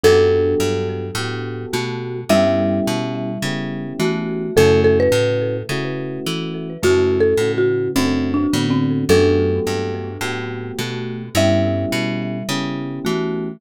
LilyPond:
<<
  \new Staff \with { instrumentName = "Marimba" } { \time 4/4 \key fis \phrygian \tempo 4 = 106 a'1 | e''1 | a'8 a'16 b'4~ b'16 r2 | \tuplet 3/2 { fis'4 a'4 fis'4 c'4 d'4 c'4 } |
a'1 | e''1 | }
  \new Staff \with { instrumentName = "Marimba" } { \time 4/4 \key fis \phrygian <fis d'>2. <a fis'>4 | <g e'>2. <a fis'>4 | <cis a>2. r4 | <cis a>2. <d b>4 |
<fis d'>2. <a fis'>4 | <g e'>2. <a fis'>4 | }
  \new Staff \with { instrumentName = "Electric Piano 2" } { \time 4/4 \key fis \phrygian <b fis' g' a'>2 <b fis' g' a'>2 | <b cis' e' g'>2 <b cis' e' g'>2 | <a cis' e' fis'>2 <a cis' e' fis'>2 | <a cis' e' fis'>4 <a cis' e' fis'>4 <a c' d' fis'>4 <a c' d' fis'>4 |
<a b fis' g'>2 <a b fis' g'>2 | <b cis' e' g'>2 <b cis' e' g'>2 | }
  \new Staff \with { instrumentName = "Electric Bass (finger)" } { \clef bass \time 4/4 \key fis \phrygian fis,4 g,4 a,4 b,4 | g,4 b,4 cis4 e4 | fis,4 a,4 cis4 e4 | fis,4 a,4 fis,4 a,4 |
fis,4 g,4 a,4 b,4 | g,4 b,4 cis4 e4 | }
>>